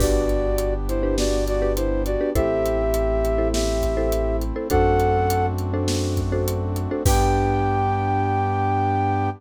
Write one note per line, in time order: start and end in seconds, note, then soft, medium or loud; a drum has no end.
0.00 2.16 G1 loud
0.00 2.33 B3 medium
0.00 0.47 D4 medium
0.00 2.33 D4 medium
0.00 0.74 F#4 medium
0.00 0.47 G4 medium
0.00 2.33 G4 medium
0.00 0.47 B4 medium
0.00 0.74 D5 medium
0.00 kick medium
0.00 crash medium
0.29 closed hi-hat medium
0.58 closed hi-hat medium
0.88 1.16 E4 medium
0.88 1.16 C5 medium
0.88 closed hi-hat medium
1.03 1.50 D4 medium
1.03 1.50 G4 medium
1.03 1.50 B4 medium
1.18 1.44 F#4 medium
1.18 1.44 D5 medium
1.18 snare loud
1.47 1.73 F#4 medium
1.47 1.73 D5 medium
1.47 closed hi-hat medium
1.62 2.09 D4 medium
1.62 2.09 G4 medium
1.62 2.09 B4 medium
1.76 2.02 E4 medium
1.76 2.02 C5 medium
1.76 closed hi-hat medium
2.06 2.30 F#4 medium
2.06 2.30 D5 medium
2.06 closed hi-hat medium
2.21 2.32 D4 medium
2.21 2.32 G4 medium
2.21 2.32 B4 medium
2.35 4.52 A1 loud
2.35 4.69 A3 medium
2.35 4.69 C4 medium
2.35 2.82 E4 loud
2.35 4.69 E4 medium
2.35 3.48 G4 medium
2.35 2.82 A4 medium
2.35 2.82 C5 medium
2.35 3.48 E5 loud
2.35 kick medium
2.35 closed hi-hat medium
2.66 closed hi-hat medium
2.94 closed hi-hat medium
3.25 closed hi-hat medium
3.38 3.85 E4 medium
3.38 3.85 A4 medium
3.38 3.85 C5 medium
3.53 4.36 G4 medium
3.53 4.36 E5 medium
3.53 snare loud
3.82 kick medium
3.82 closed hi-hat medium
3.97 4.44 E4 medium
3.97 4.44 A4 medium
3.97 4.44 C5 medium
4.12 closed hi-hat medium
4.41 closed hi-hat medium
4.56 4.68 E4 medium
4.56 4.68 A4 medium
4.56 4.68 C5 medium
4.70 6.87 F#2 loud
4.70 7.03 A3 medium
4.70 7.03 C4 medium
4.70 7.03 D4 medium
4.70 5.18 D4 loud
4.70 7.03 F#4 medium
4.70 5.18 F#4 medium
4.70 5.18 A4 medium
4.70 5.46 A4 loud
4.70 5.18 C5 medium
4.70 5.46 F#5 loud
4.70 kick medium
4.70 closed hi-hat medium
5.00 closed hi-hat medium
5.30 closed hi-hat medium
5.58 closed hi-hat medium
5.74 6.21 D4 medium
5.74 6.21 F#4 medium
5.74 6.21 A4 medium
5.74 6.21 C5 medium
5.88 snare loud
6.17 kick medium
6.17 closed hi-hat medium
6.32 6.79 D4 medium
6.32 6.79 F#4 medium
6.32 6.79 A4 medium
6.32 6.79 C5 medium
6.48 closed hi-hat medium
6.76 closed hi-hat medium
6.91 7.03 D4 medium
6.91 7.03 F#4 medium
6.91 7.03 A4 medium
6.91 7.03 C5 medium
7.06 9.29 G2 loud
7.06 9.30 B3 medium
7.06 9.29 D4 loud
7.06 9.30 D4 loud
7.06 9.29 G4 loud
7.06 9.30 G4 loud
7.06 9.29 B4 loud
7.06 9.29 G5 loud
7.06 kick loud
7.06 crash loud